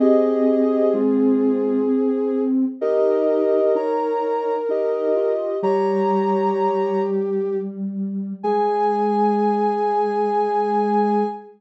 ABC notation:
X:1
M:3/4
L:1/8
Q:1/4=64
K:Ab
V:1 name="Ocarina"
[Ge]2 [A,F]2 z2 | [Ge]2 [db]2 [Ge]2 | [db]3 z3 | a6 |]
V:2 name="Ocarina"
A6 | B6 | G5 z | A6 |]
V:3 name="Ocarina"
C6 | E2 E2 E F | G,6 | A,6 |]